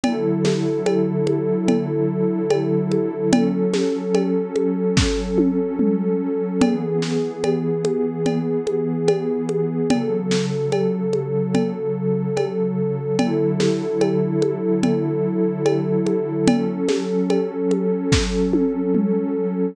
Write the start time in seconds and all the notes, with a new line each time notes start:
0.04 D3 F#3 E4 A4, cowbell, low conga
0.45 snare, high conga
0.86 cowbell, high conga
1.27 high conga
1.68 cowbell, low conga
2.51 cowbell, high conga
2.92 high conga
3.32 F#3 C#4 A4, cowbell, low conga
3.74 snare, high conga
4.15 cowbell, high conga
4.56 high conga
4.97 kick, snare
5.38 high tom
5.79 mid tom
6.61 E3 B3 G#4, cowbell, low conga
7.02 snare
7.44 cowbell, high conga
7.85 high conga
8.26 cowbell, low conga
8.67 high conga
9.08 cowbell, high conga
9.49 high conga
9.90 C#3 F#3 A4, cowbell, low conga
10.31 snare
10.72 cowbell, high conga
11.13 high conga
11.55 cowbell, low conga
12.37 cowbell, high conga
13.19 D3 F#3 E4 A4, cowbell, low conga
13.60 snare, high conga
14.01 cowbell, high conga
14.42 high conga
14.83 cowbell, low conga
15.66 cowbell, high conga
16.07 high conga
16.48 F#3 C#4 A4, cowbell, low conga
16.89 snare, high conga
17.30 cowbell, high conga
17.71 high conga
18.12 kick, snare
18.53 high tom
18.95 mid tom